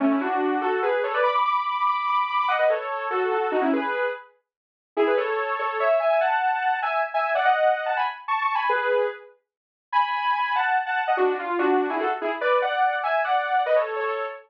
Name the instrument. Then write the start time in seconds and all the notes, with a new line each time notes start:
lead 2 (sawtooth)
0.00 A3 C#4
0.11 C#4 E4
0.21 D4 F#4
0.61 F#4 A4
0.82 G#4 B4
1.03 A4 C#5
1.14 B4 D5
1.24 B5 D6
1.35 B5 D6
1.45 B5 D6
1.86 B5 D6
2.07 B5 D6
2.28 B5 D6
2.39 B5 D6
2.48 D#5 F#5
2.59 B4 D#5
2.70 A4 C#5
3.11 F#4 A4
3.31 F#4 A4
3.52 D#4 F#4
3.61 C#4 E4
3.73 G#4 B4
4.97 E4 G#4
5.07 G#4 B4
5.17 A4 C#5
5.59 A4 C#5
5.80 C#5 E5
6.00 E5 G#5
6.10 E5 G#5
6.21 F#5 A5
6.82 E5 G#5
7.14 E5 G#5
7.35 D5 F#5
7.45 D#5 F#5
7.86 F#5 A5
7.97 G#5 B5
8.28 A5 C#6
8.42 A5 C#6
8.55 G#5 B5
8.69 G#4 B4
9.92 G#5 B5
10.55 F#5 A5
10.86 F#5 A5
11.07 D#5 F#5
11.17 D4 F#4
11.39 F4
11.59 D4 F#4
11.90 E4 G#4
12.00 F#4 A4
12.21 E4 G#4
12.41 B4 D5
12.62 D5 F#5
13.03 E5 G#5
13.24 D5 F#5
13.66 B4 D#5
13.76 A4 C#5
13.96 A4 C#5